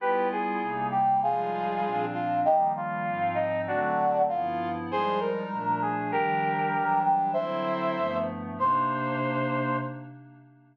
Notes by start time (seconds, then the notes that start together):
0.00 G3 B3 E4 F4 G4 B4
0.32 G#4
0.61 C3 G3 A#3 D#4
0.91 G4
1.22 F3 G3 G#3 D#4 F4 G#4
1.84 A#2 F3 C4 D4
2.13 F4
2.45 D#3 F3 G3 A#3 D#4 G4
2.76 F4
3.07 G#2 F3 C4 D#4
3.34 D#4
3.67 D3 F#3 A3 C4 D4 F#4
4.29 G2 F3 B3 E4 F4
4.90 F3 G3 G#3 D#4 G#4 C5
5.20 A#4
5.50 A#2 F3 A3 D4
5.82 G#4
6.12 D#3 F3 G3 D4 G4 A#4
6.74 E3 F#3 G3 D4
7.04 G4
7.33 D3 F#3 C4 E4 C5 E5
7.96 G2 F3 A3 B3
8.57 C3 A#3 D4 D#4 C5